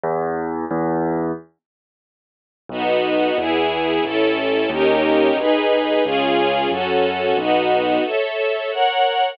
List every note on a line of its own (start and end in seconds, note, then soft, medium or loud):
0.04 0.65 E2 loud
0.71 1.32 E2 loud
2.69 3.31 B1 medium
2.69 3.37 B3 loud
2.69 3.37 D#4 medium
2.69 3.37 F#4 medium
3.38 3.99 E2 medium
3.38 4.04 B3 medium
3.38 4.04 E4 medium
3.38 4.04 G#4 medium
4.04 4.66 A1 medium
4.04 4.70 C#4 medium
4.04 4.70 E4 medium
4.04 4.70 A4 loud
4.70 5.31 D#2 medium
4.70 5.37 C#4 loud
4.70 5.37 D#4 medium
4.70 5.37 G4 medium
4.70 5.37 A#4 medium
5.37 5.99 B1 medium
5.37 6.04 D#4 loud
5.37 6.04 G#4 medium
5.37 6.04 B4 medium
6.04 6.67 C#2 medium
6.04 6.70 C#4 medium
6.04 6.70 F4 loud
6.04 6.70 G#4 loud
6.71 7.33 F#2 medium
6.71 7.37 C#4 loud
6.71 7.37 F#4 medium
6.71 7.37 A4 medium
7.37 7.98 B1 medium
7.37 8.04 B3 medium
7.37 8.04 D#4 medium
7.37 8.04 F#4 medium
8.04 8.70 A4 medium
8.04 8.70 C#5 medium
8.04 8.70 E5 medium
8.71 9.37 A#4 medium
8.71 9.37 C#5 medium
8.71 9.37 F#5 medium